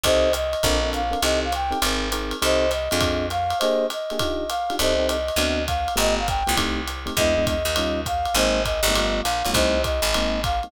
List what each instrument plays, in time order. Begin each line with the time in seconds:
0.03 electric bass (finger) C2, electric piano 1 C4 D#4 G4 A4, flute C5 D#5, kick, ride
0.33 flute D#5, hi-hat pedal, ride
0.53 ride
0.63 electric bass (finger) A#1, electric piano 1 C4 D4 A4 A#4, kick, ride
0.83 electric piano 1 C4 D4 A4 A#4
0.93 flute F5, hi-hat pedal, ride
1.11 electric piano 1 C4 D4 A4 A#4, ride
1.22 electric bass (finger) C2, electric piano 1 C4 D#4 G4 A4, flute D#5, ride
1.44 flute F5
1.52 flute G5, hi-hat pedal, ride
1.71 electric piano 1 C4 D#4 G4 A4, ride
1.82 electric bass (finger) G#1, electric piano 1 C4 D#4 G#4 A#4, ride
2.12 electric piano 1 C4 D#4 G#4 A#4, hi-hat pedal, ride
2.31 ride
2.42 electric bass (finger) C2, electric piano 1 C4 D#4 G4 A4, flute C5 D#5, ride
2.71 flute D#5, hi-hat pedal, ride
2.91 electric bass (finger) F2, electric piano 1 C4 D4 F4 G#4, ride
3.01 kick, ride
3.30 flute F5, hi-hat pedal, ride
3.50 ride
3.59 electric piano 1 A#3 D4 G4 G#4, flute C5 D#5, ride
3.90 flute D#5, hi-hat pedal, ride
4.10 electric piano 1 A#3 D4 G4 G#4, ride
4.19 electric piano 1 D4 D#4 F4 G4, kick, ride
4.49 flute F5, hi-hat pedal, ride
4.70 electric piano 1 D4 D#4 F4 G4, ride
4.79 electric bass (finger) C2, electric piano 1 C4 D#4 G4 A4, flute C5 D#5, ride
4.99 electric piano 1 C4 D#4 G4 A4
5.08 flute D#5, hi-hat pedal, ride
5.28 ride
5.36 electric bass (finger) D2, electric piano 1 B3 C4 D4 F#4, ride
5.67 flute F5, kick, hi-hat pedal, ride
5.88 ride
5.96 electric bass (finger) G1, electric piano 1 A3 B3 F4 G4, flute D#5, ride
6.19 flute F5
6.28 flute G5, kick, hi-hat pedal, ride
6.47 electric bass (finger) C2, electric piano 1 A3 B3 F4 G4, ride
6.57 electric piano 1 A3 C4 D#4 G4, kick, ride
6.87 hi-hat pedal, ride
7.06 electric piano 1 A3 C4 D#4 G4, ride
7.17 electric bass (finger) E2, electric piano 1 G#3 B3 D4 E4, flute D#5, kick, ride
7.37 electric piano 1 G#3 B3 D4 E4
7.47 flute D#5, kick, hi-hat pedal, ride
7.65 electric bass (finger) D#2, ride
7.76 electric piano 1 G3 C#4 D#4 F4, ride
8.06 flute F5, kick, hi-hat pedal, ride
8.25 ride
8.34 electric bass (finger) G#1, electric piano 1 G#3 A#3 C4 D#4, flute C5 D#5, ride
8.64 flute D#5, kick, hi-hat pedal, ride
8.83 electric bass (finger) G1, ride
8.88 electric piano 1 G#3 A#3 C4 D#4
8.95 electric piano 1 G3 A3 B3 F4, ride
9.23 electric bass (finger) A#1, flute F5, hi-hat pedal, ride
9.45 electric bass (finger) B1, electric piano 1 G3 A3 B3 F4, ride
9.53 electric bass (finger) C2, electric piano 1 G3 A3 C4 D#4, flute C5 D#5, kick, ride
9.84 flute D#5, kick, hi-hat pedal, ride
10.02 electric bass (finger) G#1, ride
10.14 electric piano 1 G#3 A#3 C4 D#4, ride
10.44 flute F5, kick, hi-hat pedal, ride
10.63 electric piano 1 G#3 A#3 C4 D#4, ride